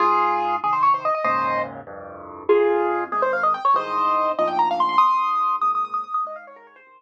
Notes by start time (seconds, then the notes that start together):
0.00 G#2 F4 G#4
0.63 C3 D#3 G#4
0.73 C5
0.83 C#5
0.94 C5
1.05 D#5
1.15 D#5
1.24 D#2 G#2 A#2 C#3 C5 D#5
1.87 C2 F2 G2
2.49 F2 F4 G#4
3.12 G#2 C3 D#3 G#4
3.22 C5
3.33 F5
3.43 D#5
3.54 G5
3.65 C#5
3.74 C2 G#2 D#3 C5 D#5
4.39 D2 G#2 A#2 F3 D#5
4.48 G5
4.59 A#5
4.71 F5
4.80 C6
4.89 C6
4.98 D#2 C6 D#6
5.61 G#2 A#2 C#3 D#6
5.75 D#6
5.85 D#6
5.94 D#6
6.04 D#6
6.14 D#6
6.25 G#2 D#5
6.36 F5
6.47 C#5
6.56 A#4
6.67 C#5
6.76 C5
6.86 C3 D#3